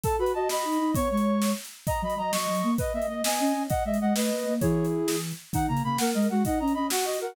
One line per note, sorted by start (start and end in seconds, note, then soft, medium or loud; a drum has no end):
0.03 0.19 A4 loud
0.03 0.16 A5 loud
0.03 kick medium
0.03 closed hi-hat medium
0.19 0.32 F#4 loud
0.19 0.32 B4 medium
0.19 0.32 B5 loud
0.26 closed hi-hat medium
0.33 0.48 F#4 loud
0.33 0.48 D#5 loud
0.33 0.48 A5 medium
0.49 0.63 F#4 medium
0.49 0.94 D#5 medium
0.49 0.91 B5 loud
0.49 snare medium
0.65 0.78 D#4 medium
0.72 closed hi-hat medium
0.80 0.93 D#4 loud
0.95 1.09 B3 loud
0.95 1.50 C#5 loud
0.95 1.08 C#6 loud
0.95 kick medium
0.95 closed hi-hat loud
1.10 1.52 G#3 medium
1.10 1.52 C#6 medium
1.17 closed hi-hat medium
1.42 snare medium
1.65 closed hi-hat medium
1.87 2.01 D#5 medium
1.87 2.02 A#5 loud
1.87 kick medium
1.87 closed hi-hat medium
2.02 2.16 F#3 loud
2.02 2.14 D#5 medium
2.02 2.18 B5 medium
2.10 closed hi-hat medium
2.17 2.32 F#3 loud
2.17 2.32 D#5 medium
2.17 2.31 A#5 loud
2.32 2.46 F#3 loud
2.32 2.71 D#5 medium
2.32 2.74 C#6 medium
2.32 snare loud
2.48 2.62 F#3 loud
2.55 closed hi-hat medium
2.63 2.76 A#3 loud
2.78 2.92 B4 loud
2.78 2.93 D#5 loud
2.78 kick medium
2.78 closed hi-hat medium
2.94 3.07 A#3 medium
2.94 3.08 D#5 medium
2.94 3.06 E5 loud
3.02 closed hi-hat medium
3.08 3.22 A#3 medium
3.08 3.22 D#5 loud
3.08 3.23 D#5 medium
3.24 3.39 B3 loud
3.24 3.63 D#5 medium
3.24 3.63 G#5 loud
3.24 snare loud
3.39 3.53 C#4 loud
3.47 closed hi-hat medium
3.55 3.67 C#4 medium
3.70 3.83 D#5 loud
3.70 3.84 F#5 loud
3.70 kick medium
3.70 closed hi-hat medium
3.85 3.99 G#3 medium
3.85 3.99 D#5 medium
3.85 3.97 E5 loud
3.94 closed hi-hat medium
4.01 4.13 G#3 medium
4.01 4.13 D#5 medium
4.01 4.14 F#5 loud
4.15 4.30 A3 loud
4.15 4.54 B4 loud
4.15 4.54 D#5 medium
4.15 snare loud
4.31 4.43 A#3 medium
4.39 closed hi-hat medium
4.46 4.59 A#3 loud
4.61 5.32 E3 loud
4.61 5.16 E4 loud
4.61 5.16 G#4 loud
4.61 4.86 C#5 loud
4.61 kick medium
4.61 closed hi-hat medium
4.85 closed hi-hat medium
5.07 5.20 G#4 loud
5.07 snare medium
5.31 closed hi-hat medium
5.53 5.68 D#3 loud
5.53 5.68 D#4 loud
5.53 5.66 F#5 loud
5.53 kick medium
5.53 closed hi-hat medium
5.68 5.81 C#3 loud
5.68 5.83 A#3 medium
5.68 5.82 A#5 loud
5.77 closed hi-hat medium
5.84 5.96 C#3 loud
5.84 5.98 A#3 loud
5.84 5.98 B5 loud
5.98 6.13 A#3 loud
5.98 6.28 A#4 loud
5.98 6.10 F#5 loud
5.98 snare loud
6.14 6.27 G#3 loud
6.14 6.27 D#5 loud
6.22 closed hi-hat medium
6.29 6.43 G#3 loud
6.29 6.43 F#4 loud
6.29 6.43 F#5 loud
6.45 6.59 D#4 loud
6.45 6.59 D#5 loud
6.45 6.59 F#5 loud
6.45 kick medium
6.45 closed hi-hat medium
6.59 6.74 C#4 loud
6.59 6.72 D#5 medium
6.59 6.73 A#5 loud
6.68 closed hi-hat medium
6.74 6.90 C#4 medium
6.74 6.88 D#5 loud
6.74 6.86 B5 loud
6.90 7.05 F#4 loud
6.90 7.17 F#4 medium
6.90 7.05 F#5 loud
6.90 snare loud
7.05 7.19 F#4 loud
7.05 7.19 D#5 loud
7.13 closed hi-hat medium
7.21 7.35 F#4 loud
7.21 7.35 A#4 loud
7.21 7.34 F#5 loud